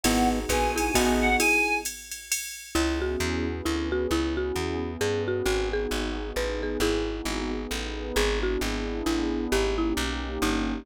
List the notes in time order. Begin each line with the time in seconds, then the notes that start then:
0.04 G#1 B3 D#4 E4 F#4 G#4 F#5, ride
0.49 A#1 G#4 B4 G#5, kick, hi-hat pedal, ride
0.76 E4 G#4 G#5, ride
0.94 A1 B3 D#4 F#4 G#4, kick, ride
1.21 F#5
1.40 E4 G#4 G#5, ride
1.85 hi-hat pedal, ride
2.11 ride
2.32 ride
2.75 C#2 B3 C#4 E4 G#4
3.02 F#4
3.20 E2
3.47 B3 C#4 G#4 B4
3.65 D2 E4
3.92 F#4
4.11 C#2 B3 C#4 E4 G#4
4.37 F#4
4.56 E2
4.83 B3 C#4 G#4 B4
5.01 G2 G#4
5.28 F#4
5.46 G#1 B3 D#4 F#4 G#4
5.73 G#4
5.91 G#1
6.18 B3 D#4 G#4 B4
6.36 A1 B4
6.63 G#4
6.80 G#1 B3 D#4 E4 F#4 G#4
7.25 G#1
7.53 B3 D#4 G#4 B4
7.71 A1
8.16 G#1 B3 D4 E4 G#4
8.43 F#4
8.61 G#1
9.06 A1 E4
9.52 G#1 A#3 C#4 D#4 G4
9.78 E4
9.97 B1
10.42 G1 D#4